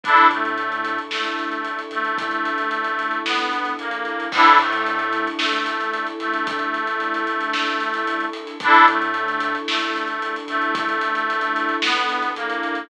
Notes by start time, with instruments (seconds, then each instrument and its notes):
0.03 synth bass 1 A1, accordion D4 E4 A4, string ensemble 1 D4 E4 A4, kick, closed hi-hat
0.17 closed hi-hat
0.30 synth bass 1 A2, accordion A3, closed hi-hat
0.45 closed hi-hat
0.58 closed hi-hat
0.72 closed hi-hat
0.85 closed hi-hat
0.98 closed hi-hat
1.11 synth bass 1 A1, accordion A3, snare
1.24 closed hi-hat
1.39 closed hi-hat
1.52 closed hi-hat
1.65 closed hi-hat
1.79 closed hi-hat
1.91 synth bass 1 A1, accordion A3, closed hi-hat
2.05 closed hi-hat
2.18 kick, closed hi-hat
2.31 closed hi-hat
2.45 closed hi-hat
2.58 closed hi-hat
2.71 closed hi-hat
2.84 closed hi-hat
2.99 closed hi-hat
3.11 closed hi-hat
3.25 synth bass 1 B1, accordion B3, snare
3.39 closed hi-hat
3.53 closed hi-hat
3.65 closed hi-hat
3.78 synth bass 1 A#1, accordion A#3, closed hi-hat
3.91 closed hi-hat
4.05 closed hi-hat
4.20 closed hi-hat
4.32 synth bass 1 A1, string ensemble 1 D4 E4 A4, accordion D4 E4, kick, crash
4.37 accordion A4
4.47 closed hi-hat
4.59 synth bass 1 A2, accordion A3, closed hi-hat
4.73 closed hi-hat
4.86 closed hi-hat
4.99 closed hi-hat
5.13 closed hi-hat
5.27 closed hi-hat
5.38 synth bass 1 A1, accordion A3, snare
5.53 closed hi-hat
5.66 closed hi-hat
5.81 closed hi-hat
5.94 closed hi-hat
6.07 closed hi-hat
6.20 synth bass 1 A1, accordion A3, closed hi-hat
6.33 closed hi-hat
6.47 kick, closed hi-hat
6.59 closed hi-hat
6.74 closed hi-hat
6.87 closed hi-hat
7.00 closed hi-hat
7.14 closed hi-hat
7.27 closed hi-hat
7.41 closed hi-hat
7.53 snare
7.67 closed hi-hat
7.80 closed hi-hat
7.94 closed hi-hat
8.07 closed hi-hat
8.20 closed hi-hat
8.33 closed hi-hat
8.47 closed hi-hat
8.60 synth bass 1 A1, string ensemble 1 D4 E4 A4, accordion D4 E4, kick, closed hi-hat
8.65 accordion A4
8.74 closed hi-hat
8.88 synth bass 1 A2, accordion A3, closed hi-hat
9.02 closed hi-hat
9.14 closed hi-hat
9.28 closed hi-hat
9.40 closed hi-hat
9.55 closed hi-hat
9.67 synth bass 1 A1, accordion A3, snare
9.81 closed hi-hat
9.96 closed hi-hat
10.08 closed hi-hat
10.22 closed hi-hat
10.36 closed hi-hat
10.48 synth bass 1 A1, accordion A3, closed hi-hat
10.62 closed hi-hat
10.75 kick, closed hi-hat
10.89 closed hi-hat
11.01 closed hi-hat
11.15 closed hi-hat
11.30 closed hi-hat
11.41 closed hi-hat
11.56 closed hi-hat
11.69 closed hi-hat
11.82 synth bass 1 B1, accordion B3, snare
11.96 closed hi-hat
12.09 closed hi-hat
12.22 closed hi-hat
12.36 synth bass 1 A#1, accordion A#3, closed hi-hat
12.50 closed hi-hat
12.63 closed hi-hat
12.75 closed hi-hat